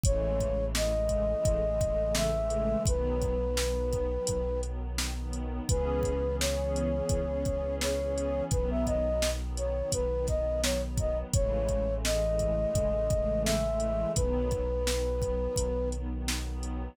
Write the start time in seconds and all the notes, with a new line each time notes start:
0.04 A1 C#3 E3 G#3 A3 C#5, kick, closed hi-hat
0.40 kick, closed hi-hat
0.59 C#3 E3 G#3 A3
0.74 C#3 E3 G#3 A3 D#5, snare
0.95 C#3 E3 G#3 A3
1.09 kick, closed hi-hat
1.31 C#3 E3 G#3 A3
1.45 A1, kick, closed hi-hat
1.66 C#3 E3 G#3 A3
1.80 C#3 E3 G#3 A3, kick, closed hi-hat
2.00 C#3 E3 G#3 A3
2.15 E5, snare
2.34 C#3 E3 G#3 A3
2.50 closed hi-hat
2.86 B1 D#3 F#3 B3 B4, kick, closed hi-hat
3.21 kick, closed hi-hat
3.42 D#3 F#3 B3
3.57 D#3 F#3 B3, snare
3.78 D#3 F#3 B3
3.92 kick, closed hi-hat
4.12 D#3 F#3 B3
4.27 B1, kick, closed hi-hat
4.47 D#3 F#3 B3
4.63 D#3 F#3 B3, closed hi-hat
4.84 D#3 F#3 B3
4.98 snare
5.18 D#3 F#3 B3
5.33 closed hi-hat
5.68 C#2 E3 B3 C#4 G#4 B4, kick, closed hi-hat
6.03 kick, closed hi-hat
6.25 E3 B3 C#4 G#4
6.39 E3 B3 C#4 G#4 C#5, snare
6.59 E3 B3 C#4 G#4
6.76 closed hi-hat
6.94 E3 B3 C#4 G#4
7.09 C#2, kick, closed hi-hat
7.29 E3 B3 C#4 G#4
7.45 E3 B3 C#4 G#4, kick, closed hi-hat
7.64 E3 B3 C#4 G#4
7.81 C#5, snare
8.00 E3 B3 C#4 G#4
8.18 closed hi-hat
8.51 B1 D#3 F#3 B3 B4, kick, closed hi-hat
8.71 E5
8.86 D#5, kick, closed hi-hat
9.06 D#3 F#3 B3
9.22 D#3 F#3 B3, snare
9.43 D#3 F#3 B3
9.57 C#5, closed hi-hat
9.75 D#3 F#3 B3
9.92 B1 B4, kick, closed hi-hat
10.11 D#3 F#3 B3
10.27 D#3 F#3 B3 D#5, kick, snare, closed hi-hat
10.46 D#3 F#3 B3
10.63 C#5, snare
10.84 D#3 F#3 B3
10.97 D#5, kick, closed hi-hat
11.33 A1 C#3 E3 G#3 A3 C#5, kick, closed hi-hat
11.69 kick, closed hi-hat
11.88 C#3 E3 G#3 A3
12.04 C#3 E3 G#3 A3 D#5, snare
12.23 C#3 E3 G#3 A3
12.39 kick, closed hi-hat
12.59 C#3 E3 G#3 A3
12.74 A1, kick, closed hi-hat
12.94 C#3 E3 G#3 A3
13.10 C#3 E3 G#3 A3, kick, closed hi-hat
13.30 C#3 E3 G#3 A3
13.45 E5, snare
13.65 C#3 E3 G#3 A3
13.80 closed hi-hat
14.15 B1 D#3 F#3 B3 B4, kick, closed hi-hat
14.51 kick, closed hi-hat
14.72 D#3 F#3 B3
14.86 D#3 F#3 B3, snare
15.06 D#3 F#3 B3
15.22 kick, closed hi-hat
15.41 D#3 F#3 B3
15.56 B1, kick, closed hi-hat
15.77 D#3 F#3 B3
15.92 D#3 F#3 B3, closed hi-hat
16.12 D#3 F#3 B3
16.28 snare
16.47 D#3 F#3 B3
16.63 closed hi-hat